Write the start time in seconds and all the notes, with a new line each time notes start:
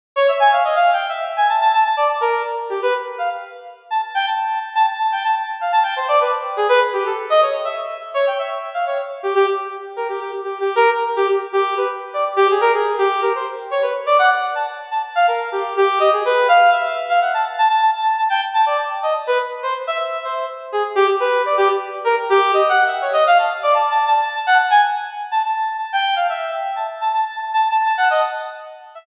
0.16 C#5
0.29 E5
0.40 G#5
0.52 F5
0.64 D#5
0.76 F5
0.93 G5
1.09 E5
1.37 G#5
1.49 A5
1.61 A5
1.73 A5
1.85 A5
1.97 D5
2.21 A#4
2.70 G4
2.82 B4
3.18 F5
3.91 A5
4.15 G5
4.26 A5
4.75 A5
5.00 A5
5.12 G5
5.24 A5
5.61 F5
5.72 A5
5.83 G5
5.96 C5
6.08 D5
6.20 B4
6.57 G#4
6.69 B4
6.93 G4
7.06 A4
7.30 D#5
7.42 C#5
7.65 E5
8.14 C#5
8.27 G5
8.39 E5
8.74 F5
8.87 C#5
9.23 G4
9.35 G4
9.96 A#4
10.09 G4
10.20 G4
10.44 G4
10.60 G4
10.76 A#4
11.16 G4
11.28 G4
11.53 G4
11.77 B4
12.14 D5
12.36 G4
12.50 G#4
12.61 A#4
12.74 G#4
12.99 G4
13.22 A#4
13.35 C5
13.71 C#5
13.82 B4
14.06 D5
14.19 F#5
14.55 A5
14.91 A5
15.15 F5
15.28 A#4
15.52 G4
15.77 G4
16.00 D#5
16.12 G#4
16.25 B4
16.48 F5
16.72 E5
17.09 F5
17.21 F#5
17.34 A5
17.58 A5
17.69 A5
17.94 A5
18.18 A5
18.30 G5
18.54 A5
18.66 D5
19.03 D#5
19.27 B4
19.63 C5
19.87 E5
20.24 C5
20.72 G#4
20.95 G4
21.20 B4
21.46 D5
21.57 G4
22.04 A#4
22.30 G4
22.53 D#5
22.69 F#5
22.87 E5
23.02 C#5
23.13 D#5
23.27 F5
23.39 A5
23.63 D5
23.74 A5
23.90 A5
24.07 A5
24.35 A5
24.47 F#5
24.70 G#5
25.31 A5
25.44 A5
25.93 G5
26.16 F5
26.29 E5
26.76 A5
27.01 A5
27.14 A5
27.38 A5
27.54 A5
27.70 A5
27.86 A5
27.98 F#5
28.10 D#5
28.95 E5